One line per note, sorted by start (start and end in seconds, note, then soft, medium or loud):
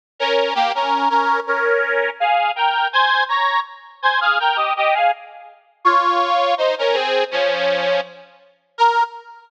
0.20 0.54 C#4 medium
0.20 0.54 A#4 medium
0.55 0.72 A#3 medium
0.55 0.72 G4 medium
0.75 1.09 C#4 medium
0.75 1.09 A#4 medium
1.10 1.40 C#4 medium
1.10 1.40 A#4 medium
1.47 2.10 C#4 medium
1.47 2.10 A#4 medium
2.20 2.52 G#4 medium
2.20 2.52 F5 medium
2.56 2.88 A#4 medium
2.56 2.88 G5 medium
2.93 3.24 C5 medium
2.93 3.24 G#5 medium
3.29 3.60 C#5 medium
3.29 3.60 A#5 medium
4.02 4.20 C5 medium
4.02 4.20 G#5 medium
4.21 4.38 G#4 medium
4.21 4.38 F5 medium
4.40 4.57 A#4 medium
4.40 4.57 G5 medium
4.56 4.73 G4 medium
4.56 4.73 D#5 medium
4.77 4.94 G4 medium
4.77 4.94 D#5 medium
4.94 5.11 G#4 medium
4.94 5.11 F5 medium
5.85 6.54 F4 medium
5.85 6.54 C#5 medium
6.58 6.75 D#4 medium
6.58 6.75 C5 medium
6.79 6.96 C#4 medium
6.79 6.96 A#4 medium
6.93 7.24 C4 medium
6.93 7.24 G#4 medium
7.31 8.01 F3 medium
7.31 8.01 C#4 medium
8.78 9.04 A#4 loud